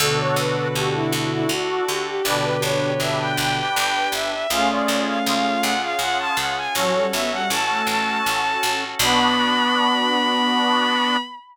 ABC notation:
X:1
M:3/4
L:1/16
Q:1/4=80
K:Bm
V:1 name="Violin"
A c B B G E E E F2 G G | d B c c e g g g g2 e e | ^e d2 e e2 f e f a f ^g | c2 e f a2 a6 |
b12 |]
V:2 name="Violin"
[B,,D,]8 z4 | [B,,D,]8 z4 | [A,C]8 z4 | F, G, B, G, z A,3 z4 |
B,12 |]
V:3 name="Accordion"
[DFA]4 [DFA]8 | [DGB]4 [DGB]8 | [C^E^G]4 [CEG]8 | [CFA]4 [CFA]8 |
[B,DF]12 |]
V:4 name="Harpsichord" clef=bass
D,,2 D,,2 D,,2 D,,2 D,,2 D,,2 | G,,,2 G,,,2 G,,,2 G,,,2 G,,,2 G,,,2 | C,,2 C,,2 C,,2 C,,2 C,,2 C,,2 | A,,,2 A,,,2 A,,,2 A,,,2 A,,,2 A,,,2 |
B,,,12 |]
V:5 name="Drawbar Organ"
[DFA]12 | [DGB]12 | [C^E^G]12 | [CFA]12 |
[B,DF]12 |]